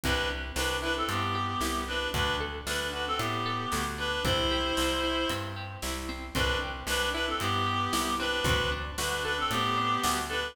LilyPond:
<<
  \new Staff \with { instrumentName = "Clarinet" } { \time 4/4 \key g \major \tempo 4 = 114 <d' b'>8 r8 <d' b'>8 <d' b'>16 <c' a'>16 <b g'>4. <d' b'>8 | <d' b'>8 r8 <d' b'>8 <d' b'>16 <c' a'>16 <b g'>4. <d' b'>8 | <e' c''>2~ <e' c''>8 r4. | <d' b'>8 r8 <d' b'>8 <d' b'>16 <c' a'>16 <b g'>4. <d' b'>8 |
<d' b'>8 r8 <d' b'>8 <d' b'>16 <c' a'>16 <b g'>4. <d' b'>8 | }
  \new Staff \with { instrumentName = "Acoustic Guitar (steel)" } { \time 4/4 \key g \major c'8 g'8 c'8 e'8 c'8 g'8 e'8 c'8 | d'8 a'8 d'8 fis'8 d'8 a'8 fis'8 d'8 | c'8 g'8 c'8 e'8 c'8 g'8 e'8 c'8 | c'8 g'8 c'8 e'8 c'8 g'8 e'8 c'8 |
c'8 d'8 fis'8 a'8 c'8 d'8 fis'8 a'8 | }
  \new Staff \with { instrumentName = "Electric Bass (finger)" } { \clef bass \time 4/4 \key g \major c,4 c,4 g,4 c,4 | d,4 d,4 a,4 d,4 | c,4 c,4 g,4 c,4 | c,4 c,4 g,4 c,4 |
d,4 d,4 a,4 d,4 | }
  \new DrumStaff \with { instrumentName = "Drums" } \drummode { \time 4/4 <hh bd>4 sn4 hh4 sn4 | <hh bd>4 sn4 hh4 sn4 | <hh bd>4 sn4 hh4 sn4 | <hh bd>4 sn4 hh4 sn4 |
<hh bd>4 sn4 hh4 sn4 | }
>>